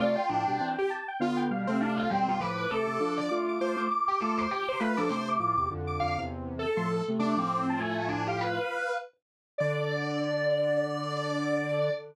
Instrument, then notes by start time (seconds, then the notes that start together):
lead 1 (square)
0.00 C3 A3 F4 D5
0.15 G5
0.29 A2 F3 D4
0.48 B2 G3
0.60 E3 C4
0.79 G4
0.90 A5
1.08 G5
1.20 D3 B3 F4 F5
1.37 G5
1.51 B2 G3 F5
1.67 C3 A3 C4
1.80 D4 F5
1.97 F4 F5
2.10 B2 G3 C4 G5
2.27 B2 G3 F4
2.40 A2 F3 B4 D6
2.58 D6
2.70 C3 A3 A4
2.87 C3 A3
3.00 F3 D4
3.18 D5
3.29 A3 F4 D6
3.48 D6
3.60 A3 F4 C5 D6
3.76 A3 F4 D6
3.90 D6
4.08 G4
4.20 A3 F4 A4 D6
4.38 C5 D6
4.51 G4 D6
4.69 C5
4.80 A3 F4 B4 B5
4.97 F3 D4 A4 D6
5.09 C3 A3 C5
5.29 D6
5.40 A2 F3 D6
5.57 E2 C3 D6
5.70 F2 D3
5.87 D6
6.00 F2 D3 F5
6.18 E2 C3
6.59 A4
6.77 A2 F3 C6
7.08 C3 A3
7.19 C3 A3 D4 D6
7.36 A2 F3 C4 D6
7.70 A5
7.80 A3 G#5
7.99 G#5
8.09 D4
8.27 G4 F5
8.41 B4
9.58 D3 D5